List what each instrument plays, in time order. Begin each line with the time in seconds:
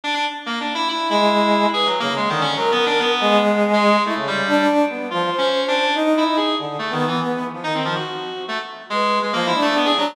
0.04 clarinet D4
0.14 clarinet D4
0.46 clarinet A#3
0.60 clarinet D4
0.75 clarinet E4
0.88 clarinet E4
1.09 brass section G#3, clarinet E4
1.73 clarinet G#4, brass section B4
1.86 clarinet F#3
2.00 brass section C#3, clarinet A#3
2.16 clarinet G#3
2.29 brass section D3, clarinet D#3
2.41 clarinet C#4
2.56 clarinet F#3, brass section A#4
2.72 clarinet B3
2.86 clarinet D4
2.99 clarinet B3
3.20 brass section G#3
3.73 clarinet G#3
4.05 clarinet A3, brass section E4
4.15 brass section C#3
4.27 clarinet G3
4.47 brass section D4
4.89 brass section B3
5.10 brass section F3, clarinet F4
5.32 brass section C5
5.38 clarinet C#4
5.68 clarinet D4
5.95 brass section D#4
6.17 clarinet E4
6.27 brass section D#4
6.37 clarinet G#4
6.58 brass section D3
6.79 clarinet A3
6.90 clarinet D#3, brass section B3
7.07 clarinet E3
7.54 brass section F3
7.64 brass section D#3, clarinet D#4
7.74 clarinet C4
7.85 clarinet F3
7.95 clarinet F#4
8.48 clarinet A3
8.90 clarinet G#3, brass section B4
9.23 clarinet G#3
9.33 brass section F3, clarinet A#3
9.47 clarinet E4
9.54 brass section D4
9.62 clarinet A3
9.76 clarinet B3
9.85 clarinet G#4
9.97 clarinet F#3, brass section D4